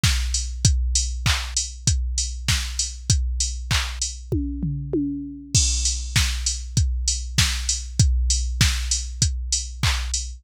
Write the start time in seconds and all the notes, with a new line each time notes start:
0.04 kick, snare
0.34 open hi-hat
0.65 kick, closed hi-hat
0.95 open hi-hat
1.26 kick, clap
1.57 open hi-hat
1.87 kick, closed hi-hat
2.18 open hi-hat
2.48 kick, snare
2.79 open hi-hat
3.10 kick, closed hi-hat
3.40 open hi-hat
3.71 kick, clap
4.02 open hi-hat
4.32 kick, high tom
4.63 floor tom
4.93 high tom
5.55 kick, crash
5.85 open hi-hat
6.16 kick, snare
6.46 open hi-hat
6.77 kick, closed hi-hat
7.08 open hi-hat
7.38 kick, snare
7.69 open hi-hat
7.99 kick, closed hi-hat
8.30 open hi-hat
8.61 kick, snare
8.91 open hi-hat
9.22 kick, closed hi-hat
9.52 open hi-hat
9.83 kick, clap
10.14 open hi-hat